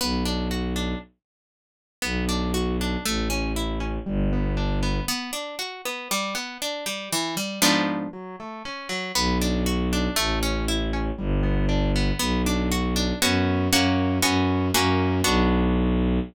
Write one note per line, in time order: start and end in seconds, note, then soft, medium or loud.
0.01 0.94 B1 medium
0.01 0.24 B3 loud
0.25 0.48 D4 medium
0.51 0.74 F#4 medium
0.76 0.99 D4 medium
2.02 2.97 B1 medium
2.02 2.25 B3 loud
2.29 2.52 D4 medium
2.54 2.77 F#4 medium
2.81 3.04 D4 medium
3.05 3.99 A1 medium
3.05 3.28 A3 loud
3.30 3.53 C#4 medium
3.56 3.79 E4 medium
3.80 4.03 C#4 medium
4.06 5.00 G1 medium
4.06 4.29 G3 loud
4.33 4.56 B3 medium
4.57 4.80 D4 medium
4.83 5.06 B3 medium
5.08 5.31 B3 loud
5.33 5.56 D4 medium
5.59 5.82 F#4 medium
5.85 6.08 B3 medium
6.11 6.34 G3 loud
6.35 6.58 B3 medium
6.62 6.85 D4 medium
6.86 7.09 G3 medium
7.13 7.35 E3 loud
7.37 7.60 G3 medium
7.62 8.08 G#2 loud
7.62 8.08 F3 loud
7.62 8.08 B3 loud
7.62 8.08 D4 loud
8.13 8.36 F#3 loud
8.40 8.63 A3 medium
8.65 8.88 C#4 medium
8.89 9.12 F#3 medium
9.15 10.08 B1 medium
9.15 9.38 B3 loud
9.41 9.64 D4 medium
9.66 9.89 F#4 medium
9.93 10.16 D4 medium
10.16 11.11 A1 medium
10.16 10.39 A3 loud
10.43 10.66 C#4 medium
10.68 10.91 E4 medium
10.93 11.16 C#4 medium
11.18 12.12 G1 medium
11.18 11.41 G3 loud
11.43 11.66 B3 medium
11.69 11.92 D4 medium
11.96 12.19 B3 medium
12.19 13.13 B1 medium
12.19 12.42 B3 loud
12.46 12.69 D4 medium
12.72 12.94 F#4 medium
12.96 13.19 D4 medium
13.22 13.69 F#2 medium
13.22 13.68 B3 loud
13.22 13.68 C#4 loud
13.22 13.68 F#4 loud
13.73 14.20 F#2 medium
13.73 14.18 A#3 loud
13.73 14.18 C#4 loud
13.73 14.18 F#4 loud
14.22 14.71 F#2 medium
14.22 14.68 B3 loud
14.22 14.68 C#4 loud
14.22 14.68 F#4 loud
14.74 15.22 F#2 medium
14.74 15.20 A#3 loud
14.74 15.20 C#4 loud
14.74 15.20 F#4 loud
15.24 16.19 B1 loud
15.24 16.19 B3 medium
15.24 16.19 D4 loud
15.24 16.19 F#4 loud